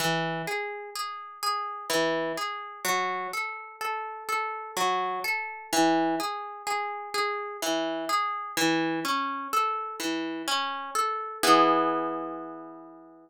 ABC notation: X:1
M:3/4
L:1/8
Q:1/4=63
K:E
V:1 name="Orchestral Harp"
E, G G G E, G | F, A A A F, A | E, G G G E, G | E, C A E, C A |
[E,B,G]6 |]